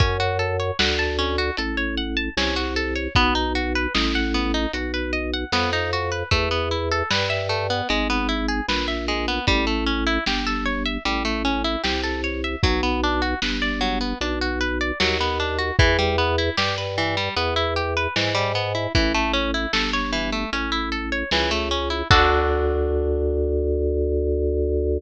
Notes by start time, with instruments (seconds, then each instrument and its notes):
0.00 drawbar organ F#2, orchestral harp C#4, kick, closed hi-hat
0.20 orchestral harp F#4
0.39 orchestral harp A4
0.60 orchestral harp C#5
0.79 drawbar organ D2, orchestral harp F#5, snare
0.99 orchestral harp A5
1.19 orchestral harp C#4
1.38 orchestral harp F#4
1.57 drawbar organ A1, orchestral harp A4, closed hi-hat
1.77 orchestral harp C#5
1.97 orchestral harp F#5
2.17 orchestral harp A5
2.37 drawbar organ C2, orchestral harp C#4, snare
2.56 orchestral harp F#4
2.76 orchestral harp A4
2.96 orchestral harp C#5
3.15 drawbar organ B1, orchestral harp B3, kick, closed hi-hat
3.35 orchestral harp D#4
3.55 orchestral harp F#4
3.75 orchestral harp B4
3.94 drawbar organ A1, orchestral harp D#5, snare
4.15 orchestral harp F#5
4.34 orchestral harp B3
4.54 orchestral harp D#4
4.73 drawbar organ B1, orchestral harp F#4, closed hi-hat
4.94 orchestral harp B4
5.13 orchestral harp D#5
5.34 orchestral harp F#5
5.52 drawbar organ F2, orchestral harp B3, snare
5.73 orchestral harp D#4
5.93 orchestral harp F#4
6.12 orchestral harp B4
6.31 drawbar organ E2, orchestral harp A3, kick, closed hi-hat
6.51 orchestral harp B3
6.71 orchestral harp E4
6.91 orchestral harp A4
7.11 drawbar organ G2, orchestral harp B4, snare
7.30 orchestral harp E5
7.49 orchestral harp A3
7.70 orchestral harp B3
7.89 drawbar organ G#1, orchestral harp G#3, closed hi-hat
8.10 orchestral harp B3
8.29 orchestral harp E4
8.49 orchestral harp G#4
8.68 drawbar organ A#1, orchestral harp B4, snare
8.88 orchestral harp E5
9.08 orchestral harp G#3
9.28 orchestral harp B3
9.47 drawbar organ A1, orchestral harp G3, kick, closed hi-hat
9.67 orchestral harp A3
9.87 orchestral harp C#4
10.07 orchestral harp E4
10.26 drawbar organ G1, orchestral harp G4, snare
10.47 orchestral harp A4
10.65 orchestral harp C#5
10.86 orchestral harp E5
11.05 drawbar organ A1, orchestral harp G3, closed hi-hat
11.25 orchestral harp A3
11.45 orchestral harp C#4
11.64 orchestral harp E4
11.84 drawbar organ C2, orchestral harp G4, snare
12.03 orchestral harp A4
12.24 orchestral harp C#5
12.44 orchestral harp E5
12.63 drawbar organ B1, orchestral harp F#3, kick, closed hi-hat
12.83 orchestral harp B3
13.04 orchestral harp D4
13.22 orchestral harp F#4
13.42 drawbar organ G1, orchestral harp B4, snare
13.62 orchestral harp D5
13.81 orchestral harp F#3
14.01 orchestral harp B3
14.21 drawbar organ B1, orchestral harp D4, closed hi-hat
14.41 orchestral harp F#4
14.61 orchestral harp B4
14.81 orchestral harp D5
15.00 drawbar organ D#2, orchestral harp F#3, snare
15.21 orchestral harp B3
15.40 orchestral harp D4
15.59 orchestral harp F#4
15.79 drawbar organ E2, orchestral harp E3, kick, closed hi-hat
15.99 orchestral harp G3
16.18 orchestral harp B3
16.38 orchestral harp E4
16.57 drawbar organ G2, orchestral harp G4, snare
16.78 orchestral harp B4
16.98 orchestral harp E3
17.17 orchestral harp G3
17.36 drawbar organ E2, orchestral harp B3, closed hi-hat
17.56 orchestral harp E4
17.76 orchestral harp G4
17.97 orchestral harp B4
18.16 drawbar organ G#2, orchestral harp E3, snare
18.35 orchestral harp G3
18.55 orchestral harp B3
18.75 orchestral harp E4
18.95 drawbar organ A1, orchestral harp E3, kick, closed hi-hat
19.14 orchestral harp A3
19.33 orchestral harp C#4
19.54 orchestral harp E4
19.73 drawbar organ G1, orchestral harp A4, snare
19.93 orchestral harp C#5
20.13 orchestral harp E3
20.32 orchestral harp A3
20.52 drawbar organ A1, orchestral harp C#4, closed hi-hat
20.72 orchestral harp E4
20.92 orchestral harp A4
21.12 orchestral harp C#5
21.31 drawbar organ C#2, orchestral harp E3, snare
21.51 orchestral harp A3
21.71 orchestral harp C#4
21.90 orchestral harp E4
22.10 drawbar organ D2, orchestral harp D4 F#4 A4, kick, crash